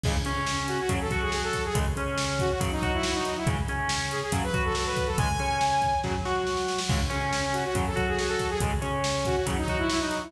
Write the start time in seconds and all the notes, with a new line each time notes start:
0.04 C#2 C#3 G#3, kick, crash
0.25 C#3 C#4, closed hi-hat
0.47 snare
0.67 F#4, closed hi-hat
0.79 F#4
0.89 F#2 C#3 F#3, kick, closed hi-hat
1.01 A4
1.11 F#3 F#4, kick, closed hi-hat
1.22 G#4
1.32 G#4, snare
1.43 A4
1.53 kick, closed hi-hat
1.64 G#4
1.75 C#2 C#3 G#3, kick, closed hi-hat
1.97 C#3 C#4, closed hi-hat
2.18 snare
2.39 F#4, kick, closed hi-hat
2.50 F#4
2.60 F#2 C#3 F#3, kick, closed hi-hat
2.71 D#4
2.82 F#3 F#4, kick, closed hi-hat
2.93 E4
3.03 E4, snare
3.14 D#4
3.25 closed hi-hat
3.37 E4
3.47 C#2 C#3 G#3, kick, closed hi-hat
3.68 C#3 C#4, closed hi-hat
3.89 snare
4.11 G#4, closed hi-hat
4.23 G#4
4.32 F#2 C#3 F#3, kick, closed hi-hat
4.43 B4
4.54 F#3 F#4, kick, closed hi-hat
4.65 A4
4.75 A4, snare
4.86 B4
4.97 kick, closed hi-hat
5.07 A4
5.18 C#2 C#3 G#3 G#5, kick, closed hi-hat
5.39 C#3 C#4, closed hi-hat
5.61 snare
5.82 kick, closed hi-hat
6.04 F#2 C#3 F#3, kick, snare
6.25 F#3 F#4, snare
6.47 snare
6.57 snare
6.68 snare
6.78 snare
6.89 C#2 C#3 G#3, kick, crash
7.10 C#3 C#4, closed hi-hat
7.33 snare
7.53 F#4, closed hi-hat
7.64 F#4
7.75 F#2 C#3 F#3, kick, closed hi-hat
7.86 A4
7.96 F#3 F#4, kick, closed hi-hat
8.07 G#4
8.18 G#4, snare
8.28 A4
8.39 kick, closed hi-hat
8.49 G#4
8.60 C#2 C#3 G#3, kick, closed hi-hat
8.82 C#3 C#4, closed hi-hat
9.04 snare
9.25 F#4, kick, closed hi-hat
9.36 F#4
9.46 F#2 C#3 F#3, kick, closed hi-hat
9.57 D#4
9.68 F#3 F#4, kick, closed hi-hat
9.78 E4
9.89 E4, snare
10.00 D#4
10.11 closed hi-hat
10.22 E4